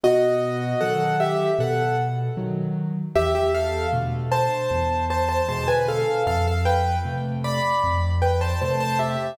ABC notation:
X:1
M:4/4
L:1/16
Q:1/4=77
K:Am
V:1 name="Acoustic Grand Piano"
[^F^d]4 [A^f]2 [Ge]2 [Af]2 z6 | [Ge] [Ge] [Af]2 z2 [ca]4 [ca] [ca] [ca] [B^g] [Af]2 | [Af] [Af] [Bg]2 z2 [db]4 [Bg] [ca] [ca] [ca] [Ge]2 |]
V:2 name="Acoustic Grand Piano"
B,,4 [^D,^F,]4 B,,4 [D,F,]4 | E,,4 [B,,D,A,]4 E,,4 [B,,D,^G,]4 | F,,4 [C,A,]4 F,,4 [C,A,]4 |]